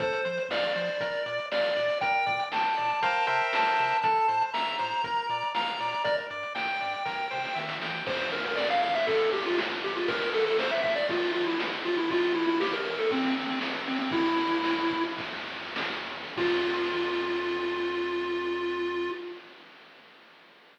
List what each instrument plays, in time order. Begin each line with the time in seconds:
0.00 synth bass 1 F2, lead 1 (square) A4 C5, kick, closed hi-hat
0.13 closed hi-hat
0.25 synth bass 1 F3, lead 1 (square) C5, closed hi-hat
0.38 closed hi-hat
0.49 synth bass 1 F2, lead 1 (square) D5 F5, snare
0.63 closed hi-hat
0.76 synth bass 1 F3, lead 1 (square) C5, closed hi-hat
0.88 closed hi-hat
1.00 synth bass 1 A#1, lead 1 (square) A#4, kick, closed hi-hat
1.14 closed hi-hat
1.26 synth bass 1 A#2, lead 1 (square) D5, closed hi-hat
1.39 closed hi-hat
1.51 synth bass 1 A#1, lead 1 (square) D5 F5, snare
1.64 closed hi-hat
1.76 synth bass 1 A#2, lead 1 (square) D5, closed hi-hat
1.89 closed hi-hat
2.01 synth bass 1 A#1, lead 1 (square) A#4 G5, kick, closed hi-hat
2.14 closed hi-hat
2.26 synth bass 1 A#2, lead 1 (square) D5, kick, closed hi-hat
2.39 closed hi-hat
2.52 synth bass 1 A#1, lead 1 (square) G5 A5, snare
2.64 closed hi-hat
2.77 synth bass 1 A#2, lead 1 (square) D5, closed hi-hat
2.90 closed hi-hat
3.01 synth bass 1 C2, lead 1 (square) A#4 C5 F5 G5, kick, closed hi-hat
3.15 closed hi-hat
3.27 synth bass 1 C3, lead 1 (square) A#4 C5 E5 G5, closed hi-hat
3.40 closed hi-hat
3.53 synth bass 1 C2, lead 1 (square) A5, snare
3.65 closed hi-hat
3.78 synth bass 1 C3, closed hi-hat
3.90 closed hi-hat
4.02 synth bass 1 A1, lead 1 (square) A4 A5, kick, closed hi-hat
4.16 closed hi-hat
4.28 synth bass 1 A2, lead 1 (square) C5, closed hi-hat
4.41 closed hi-hat
4.53 synth bass 1 A1, lead 1 (square) E5 A#5, snare
4.67 closed hi-hat
4.79 synth bass 1 A2, lead 1 (square) C5, closed hi-hat
4.92 closed hi-hat
5.03 synth bass 1 A#1, lead 1 (square) A#4, kick, closed hi-hat
5.16 closed hi-hat
5.29 synth bass 1 A#2, lead 1 (square) D5, closed hi-hat
5.42 closed hi-hat
5.55 synth bass 1 A#1, lead 1 (square) F5 A#5, snare
5.67 closed hi-hat
5.80 synth bass 1 A#2, lead 1 (square) D5, closed hi-hat
5.92 closed hi-hat
6.04 synth bass 1 G1, lead 1 (square) A#4 D5, kick, closed hi-hat
6.18 closed hi-hat
6.30 synth bass 1 G2, lead 1 (square) D5, closed hi-hat
6.43 closed hi-hat
6.55 synth bass 1 G1, lead 1 (square) G5, snare
6.68 closed hi-hat
6.81 synth bass 1 G2, lead 1 (square) D5, closed hi-hat
6.93 closed hi-hat
7.05 synth bass 1 C2, lead 1 (square) A#4, kick, snare
7.31 synth bass 1 C3, lead 1 (square) C5, snare
7.44 snare
7.55 synth bass 1 D#3, lead 1 (square) E5, snare
7.69 snare
7.80 synth bass 1 E3, lead 1 (square) G5, snare
8.06 synth bass 1 F2, lead 1 (square) C5, kick, crash
8.20 ride
8.32 lead 1 (square) A#4, ride
8.45 lead 1 (square) A#4, ride
8.57 lead 1 (square) D5, snare
8.70 lead 1 (square) F5, ride
8.82 lead 1 (square) F5, ride
8.95 lead 1 (square) E5, ride
9.07 synth bass 1 F2, lead 1 (square) A4, kick, ride
9.20 ride
9.32 lead 1 (square) G4, ride
9.46 lead 1 (square) F4, ride
9.58 snare
9.70 ride
9.83 lead 1 (square) G4, ride
9.95 lead 1 (square) F4, ride
10.08 synth bass 1 A#1, lead 1 (square) A#4, kick, ride
10.21 ride
10.33 lead 1 (square) A4, ride
10.45 lead 1 (square) A4, ride
10.59 lead 1 (square) C5, snare
10.71 lead 1 (square) E5, ride
10.83 lead 1 (square) E5, kick, ride
10.96 lead 1 (square) D5, ride
11.09 synth bass 1 A#1, lead 1 (square) F4, kick, ride
11.22 ride
11.33 lead 1 (square) F4, ride
11.46 lead 1 (square) E4, ride
11.60 snare
11.72 ride
11.85 lead 1 (square) F4, ride
11.97 lead 1 (square) E4, ride
12.10 synth bass 1 A1, lead 1 (square) F4, kick, ride
12.23 ride
12.35 lead 1 (square) E4, ride
12.47 lead 1 (square) E4, ride
12.60 lead 1 (square) G4, snare
12.73 lead 1 (square) A#4, ride
12.85 lead 1 (square) A#4, ride
12.98 lead 1 (square) A4, ride
13.11 synth bass 1 A1, lead 1 (square) C4, kick, ride
13.23 ride
13.36 lead 1 (square) C4, ride
13.47 lead 1 (square) C4, ride
13.61 snare
13.74 ride
13.87 lead 1 (square) C4, ride
13.99 lead 1 (square) C4, ride
14.10 synth bass 1 E2, lead 1 (square) E4, kick, ride
14.24 ride
14.37 ride
14.50 ride
14.64 snare
14.77 ride
14.90 kick, ride
15.04 ride
15.17 synth bass 1 E2, kick, ride
15.32 ride
15.46 ride
15.61 ride
15.76 snare
15.91 ride
16.06 ride
16.21 ride
16.36 synth bass 1 F2, lead 1 (square) F4, kick, crash